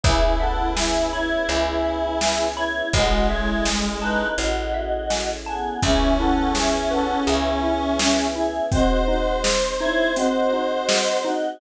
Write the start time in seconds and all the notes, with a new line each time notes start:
0.03 C#2 B3 C#4 E4 G#4 C#5 E5, kick, closed hi-hat
0.40 A4 E5 F#5
0.76 G#4 E5 G#5, snare
1.12 E4 C#5 B5
1.48 C#2 G#4 C#5 E5, closed hi-hat
1.85 E5
2.21 G#5, snare
2.56 E4 C#5 B5
2.93 A1 G#3 C#4 E4 F#4 G#4 A4 C#5 D#5, kick, closed hi-hat
3.30 E4 C#5 E5
3.65 G#5, snare
4.02 D#4 B4 A5
4.38 A1 F#4 C#5 D#5, closed hi-hat
4.74 E5
5.10 G#5, snare
5.46 B3 G#4 A5
5.82 C#2 B3 C#4 E4 G#4 E5, kick, closed hi-hat
6.18 E4 A4 F#5
6.55 G#4 E5, snare
6.91 A4 B4 F#5
7.27 C#2 G#4 E5, closed hi-hat
7.63 E4
7.99 C#4, snare
8.35 E4 G#4 E5
8.71 C4 D#4 F#4 G#4 C5 D#5, kick, closed hi-hat
9.08 D#4 F#4 D#5
9.44 G#4, snare
9.80 D#4 E4 C#5
10.15 C4 F#4 D#5, closed hi-hat
10.53 D#4
10.89 G#4, snare
11.24 D#4 F#4 D#5